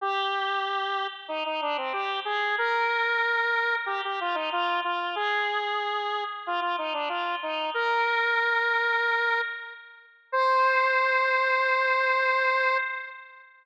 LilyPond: \new Staff { \time 4/4 \key c \minor \tempo 4 = 93 g'2 ees'16 ees'16 d'16 c'16 g'8 aes'8 | bes'2 g'16 g'16 f'16 ees'16 f'8 f'8 | aes'2 f'16 f'16 ees'16 d'16 f'8 ees'8 | bes'2. r4 |
c''1 | }